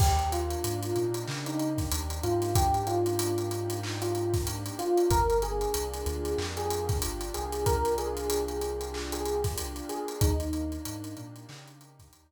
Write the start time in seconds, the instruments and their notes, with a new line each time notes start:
0.00 synth bass 2 D#2, pad 2 (warm) A#3, electric piano 1 G4, kick, crash
0.19 closed hi-hat
0.32 pad 2 (warm) D4, electric piano 1 F4, closed hi-hat
0.51 closed hi-hat
0.64 synth bass 2 G#2, pad 2 (warm) D#4, closed hi-hat
0.83 closed hi-hat
0.96 synth bass 2 A#2, pad 2 (warm) G4, closed hi-hat
1.14 closed hi-hat
1.27 synth bass 2 C#3, pad 2 (warm) D#4, clap
1.46 electric piano 1 D#4, closed hi-hat
1.59 pad 2 (warm) D4, closed hi-hat
1.78 kick, snare, closed hi-hat
1.91 synth bass 2 D#2, pad 2 (warm) A#3, closed hi-hat
2.10 closed hi-hat
2.23 synth bass 2 G#2, pad 2 (warm) D4, electric piano 1 F4, closed hi-hat
2.42 snare, closed hi-hat
2.55 pad 2 (warm) D#4, electric piano 1 G4, kick, closed hi-hat
2.74 closed hi-hat
2.87 electric piano 1 F4, pad 2 (warm) G4, closed hi-hat
3.06 closed hi-hat
3.19 pad 2 (warm) D#4, closed hi-hat
3.38 closed hi-hat
3.51 pad 2 (warm) D4, closed hi-hat
3.70 closed hi-hat
3.83 pad 2 (warm) A#3, clap
4.02 electric piano 1 F4, closed hi-hat
4.15 pad 2 (warm) D4, closed hi-hat
4.34 kick, snare, closed hi-hat
4.46 pad 2 (warm) D#4, closed hi-hat
4.66 closed hi-hat
4.79 electric piano 1 F4, pad 2 (warm) G4, closed hi-hat
4.97 closed hi-hat
5.10 synth bass 2 G1, pad 2 (warm) A#3, electric piano 1 A#4, kick, closed hi-hat
5.30 closed hi-hat
5.42 pad 2 (warm) D4, electric piano 1 G#4, closed hi-hat
5.61 closed hi-hat
5.74 synth bass 2 C2, pad 2 (warm) F4, closed hi-hat
5.94 closed hi-hat
6.06 synth bass 2 D2, pad 2 (warm) G4, closed hi-hat
6.25 closed hi-hat
6.38 synth bass 2 F2, pad 2 (warm) F4, clap
6.57 electric piano 1 G#4, closed hi-hat
6.70 pad 2 (warm) D4, closed hi-hat
6.89 kick, snare, closed hi-hat
7.02 synth bass 2 G1, pad 2 (warm) A#3, closed hi-hat
7.21 closed hi-hat
7.34 synth bass 2 C2, pad 2 (warm) D4, electric piano 1 G#4, closed hi-hat
7.52 closed hi-hat
7.66 pad 2 (warm) F4, electric piano 1 A#4, kick, closed hi-hat
7.85 closed hi-hat
7.98 pad 2 (warm) G4, electric piano 1 G#4, closed hi-hat
8.17 closed hi-hat
8.30 pad 2 (warm) F4, closed hi-hat
8.48 closed hi-hat
8.61 pad 2 (warm) D4, closed hi-hat
8.81 closed hi-hat
8.93 pad 2 (warm) A#3, clap
9.12 electric piano 1 G#4, closed hi-hat
9.26 pad 2 (warm) D4, closed hi-hat
9.44 kick, snare, closed hi-hat
9.57 pad 2 (warm) F4, closed hi-hat
9.76 closed hi-hat
9.89 pad 2 (warm) G4, electric piano 1 G#4, closed hi-hat
10.08 closed hi-hat
10.21 synth bass 2 D#2, pad 2 (warm) A#3, electric piano 1 D#4, kick, closed hi-hat
10.40 closed hi-hat
10.53 pad 2 (warm) D4, closed hi-hat
10.72 closed hi-hat
10.85 synth bass 2 G#2, pad 2 (warm) D#4, closed hi-hat
11.04 closed hi-hat
11.17 synth bass 2 A#2, pad 2 (warm) G4, closed hi-hat
11.36 closed hi-hat
11.49 synth bass 2 C#3, pad 2 (warm) D#4, clap
11.68 closed hi-hat
11.80 pad 2 (warm) D4, closed hi-hat
11.99 kick, snare, closed hi-hat
12.13 synth bass 2 D#2, pad 2 (warm) A#3, closed hi-hat